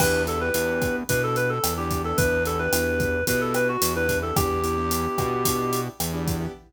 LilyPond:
<<
  \new Staff \with { instrumentName = "Clarinet" } { \time 4/4 \key e \dorian \tempo 4 = 110 b'8 a'16 b'4~ b'16 b'16 a'16 b'16 a'8 g'8 a'16 | b'8 a'16 b'4~ b'16 b'16 a'16 b'16 fis'8 b'8 a'16 | g'2. r4 | }
  \new Staff \with { instrumentName = "Acoustic Grand Piano" } { \time 4/4 \key e \dorian <b d' e' g'>8 <b d' e' g'>16 <b d' e' g'>16 <b d' e' g'>4 <b d' e' g'>4~ <b d' e' g'>16 <b d' e' g'>16 <b d' e' g'>16 <b d' e' g'>16~ | <b d' e' g'>8 <b d' e' g'>16 <b d' e' g'>16 <b d' e' g'>4 <b d' e' g'>4~ <b d' e' g'>16 <b d' e' g'>16 <b d' e' g'>16 <b d' e' g'>16 | <b d' e' g'>8 <b d' e' g'>16 <b d' e' g'>16 <b d' e' g'>4 <b d' e' g'>4~ <b d' e' g'>16 <b d' e' g'>16 <b d' e' g'>16 <b d' e' g'>16 | }
  \new Staff \with { instrumentName = "Synth Bass 1" } { \clef bass \time 4/4 \key e \dorian e,4 e,4 b,4 e,4 | e,4 e,4 b,4 e,4 | e,4. b,4. e,4 | }
  \new DrumStaff \with { instrumentName = "Drums" } \drummode { \time 4/4 <cymc bd ss>8 hh8 hh8 <hh bd ss>8 <hh bd>8 hh8 <hh ss>8 <hh bd>8 | <hh bd>8 hh8 <hh ss>8 <hh bd>8 <hh bd>8 <hh ss>8 hh8 <hh bd>8 | <hh bd ss>8 hh8 hh8 <hh bd ss>8 <hh bd>8 hh8 <hh ss>8 <hh bd>8 | }
>>